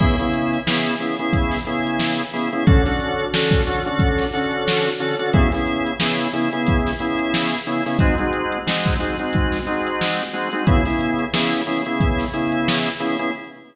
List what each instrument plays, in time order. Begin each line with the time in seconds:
0.00 drawbar organ C#3 B3 E4 G#4, kick, crash
0.19 drawbar organ C#3 B3 E4 G#4, closed hi-hat
0.34 closed hi-hat
0.53 closed hi-hat
0.67 drawbar organ C#3 B3 E4 G#4, snare
0.86 snare, closed hi-hat
1.00 drawbar organ C#3 B3 E4 G#4, closed hi-hat
1.19 drawbar organ C#3 B3 E4 G#4, closed hi-hat
1.33 kick, closed hi-hat
1.51 snare, closed hi-hat
1.65 drawbar organ C#3 B3 E4 G#4, closed hi-hat
1.87 closed hi-hat
1.99 snare
2.19 closed hi-hat
2.33 drawbar organ C#3 B3 E4 G#4, snare, closed hi-hat
2.52 drawbar organ C#3 B3 E4 G#4, closed hi-hat
2.67 drawbar organ D3 C#4 F#4 A4, kick, closed hi-hat
2.85 drawbar organ D3 C#4 F#4 A4, snare, closed hi-hat
3.00 closed hi-hat
3.20 closed hi-hat
3.33 drawbar organ D3 C#4 F#4 A4, snare
3.51 kick, closed hi-hat
3.67 drawbar organ D3 C#4 F#4 A4, closed hi-hat
3.86 drawbar organ D3 C#4 F#4 A4, closed hi-hat
3.99 kick, closed hi-hat
4.18 snare, closed hi-hat
4.33 drawbar organ D3 C#4 F#4 A4, snare, closed hi-hat
4.51 closed hi-hat
4.68 snare
4.86 closed hi-hat
5.00 drawbar organ D3 C#4 F#4 A4, closed hi-hat
5.19 drawbar organ D3 C#4 F#4 A4, closed hi-hat
5.33 drawbar organ C#3 B3 E4 G#4, kick, closed hi-hat
5.52 drawbar organ C#3 B3 E4 G#4, snare, closed hi-hat
5.67 closed hi-hat
5.86 closed hi-hat
6.00 drawbar organ C#3 B3 E4 G#4, snare
6.18 closed hi-hat
6.33 drawbar organ C#3 B3 E4 G#4, closed hi-hat
6.53 drawbar organ C#3 B3 E4 G#4, closed hi-hat
6.67 kick, closed hi-hat
6.87 snare, closed hi-hat
6.99 drawbar organ C#3 B3 E4 G#4, closed hi-hat
7.19 closed hi-hat
7.34 snare
7.53 closed hi-hat
7.67 drawbar organ C#3 B3 E4 G#4, closed hi-hat
7.86 drawbar organ C#3 B3 E4 G#4, snare, closed hi-hat
7.99 drawbar organ G#3 C4 D#4 F#4, kick, closed hi-hat
8.18 drawbar organ G#3 C4 D#4 F#4, closed hi-hat
8.33 closed hi-hat
8.52 closed hi-hat
8.67 drawbar organ G#3 C4 D#4 F#4, snare
8.85 kick, snare, closed hi-hat
9.00 drawbar organ G#3 C4 D#4 F#4, snare, closed hi-hat
9.19 drawbar organ G#3 C4 D#4 F#4, closed hi-hat
9.33 kick, closed hi-hat
9.52 snare, closed hi-hat
9.67 drawbar organ G#3 C4 D#4 F#4, closed hi-hat
9.87 closed hi-hat
10.01 snare
10.18 closed hi-hat
10.32 drawbar organ G#3 C4 D#4 F#4, closed hi-hat
10.52 drawbar organ G#3 C4 D#4 F#4, closed hi-hat
10.67 drawbar organ C#3 B3 E4 G#4, kick, closed hi-hat
10.85 drawbar organ C#3 B3 E4 G#4, snare, closed hi-hat
11.01 closed hi-hat
11.19 closed hi-hat
11.33 drawbar organ C#3 B3 E4 G#4, snare
11.52 snare, closed hi-hat
11.67 drawbar organ C#3 B3 E4 G#4, snare, closed hi-hat
11.85 drawbar organ C#3 B3 E4 G#4, closed hi-hat
12.00 kick, closed hi-hat
12.19 snare, closed hi-hat
12.33 drawbar organ C#3 B3 E4 G#4, closed hi-hat
12.52 closed hi-hat
12.68 snare
12.86 closed hi-hat
13.00 drawbar organ C#3 B3 E4 G#4, closed hi-hat
13.19 drawbar organ C#3 B3 E4 G#4, closed hi-hat